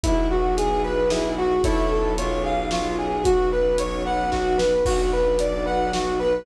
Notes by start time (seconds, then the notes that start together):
0.03 B1 B3 E4 F#4 G#4, kick, closed hi-hat
0.30 F#4
0.57 G#4, closed hi-hat
0.84 B4
1.10 E4 G#4, snare
1.37 F#4
1.64 B1 C#4 E4 A4 C#5, kick, closed hi-hat
1.91 A4
2.18 B1 C#4 F4 G#4 C#5, closed hi-hat
2.44 G#4 F5
2.71 F4 C#5, snare
2.98 G#4
3.24 B1 B3 C#4 F#4, kick, closed hi-hat
3.52 B4
3.78 C#5, closed hi-hat
4.05 B4 F#5
4.32 F#4, kick, snare
4.58 B4, snare
4.85 B1 B3 D4 F#4, kick, crash
5.12 B4
5.39 D5, closed hi-hat
5.66 F#3 B3 F#4 B4 F#5
5.92 F#4, snare
6.19 B4